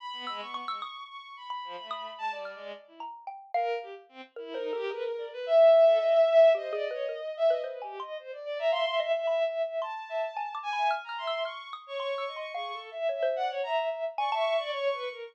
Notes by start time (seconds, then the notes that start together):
0.00 B5
0.13 B3
0.27 G#3 E6
0.40 B3 C#6
0.54 C#6
0.68 G#3 E6
0.82 D#6
1.09 C#6
1.37 B5
1.50 B5
1.64 F3
1.78 A3
1.91 D#6
2.18 G#3 A5
2.31 D5
2.36 G3
2.45 F6
2.55 G#3
2.87 E4
3.00 A#5
3.27 G5
3.54 A#4 F5
3.82 G4
4.09 C4
4.36 E4 A#4
4.51 D#4 A#4 C5
4.73 G4 A4
4.91 G#4 B4
5.18 D5
5.33 B4
5.46 E5
5.72 E5
5.86 A4
6.00 D#5
6.12 E5
6.28 E5
6.55 G4 C5 D#5
6.71 G#4 D5
6.91 B4 C#5
7.09 A#4
7.37 E5
7.50 B4 D#5
7.64 B4 C5
7.82 G4 G#5
8.00 D#5 C6
8.19 C5
8.33 D5
8.45 D5
8.58 E5 A#5
8.72 E5 F5 C6
8.86 E5
8.99 D#5 E5
9.15 E5
9.26 E5 B5
9.45 E5
9.63 E5
9.81 A5 C6
10.09 E5
10.37 G#5
10.55 D6
10.63 G#5
10.73 B5
10.77 E5
10.91 F6
11.04 A#5
11.09 F6
11.18 E5 C6
11.27 E6
11.45 C#6 F6
11.73 D#6
11.86 C#5 C#6
11.99 C6 C#6
12.18 E6
12.27 D#5
12.36 C6 C#6
12.54 G#4 F5 C#6
12.73 A4
12.91 E5
13.09 C#5 E5
13.23 C5
13.36 D5 F#5
13.50 C#5
13.63 E5 A#5
13.91 E5
14.17 D5 G#5 C#6
14.32 E5 A5
14.36 C#6
14.54 C#6
14.59 D5
14.72 C#5 C#6
14.92 B4
15.09 A#4